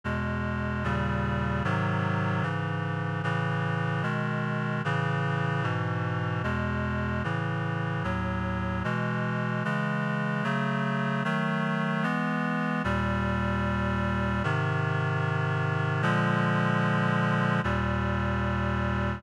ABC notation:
X:1
M:4/4
L:1/8
Q:1/4=75
K:E
V:1 name="Clarinet"
[E,,B,,G,]2 [D,,^A,,C,=G,]2 [^G,,^B,,D,F,]2 [G,,C,E,]2 | [A,,C,E,]2 [B,,D,G,]2 [A,,C,E,]2 [G,,B,,E,]2 | [E,,B,,G,]2 [A,,C,E,]2 [D,,A,,F,]2 [B,,E,G,]2 | [C,E,G,]2 [C,F,A,]2 [D,F,A,]2 [E,G,B,]2 |
[K:Eb] [E,,B,,G,]4 [A,,C,E,]4 | [B,,D,F,A,]4 [E,,B,,G,]4 |]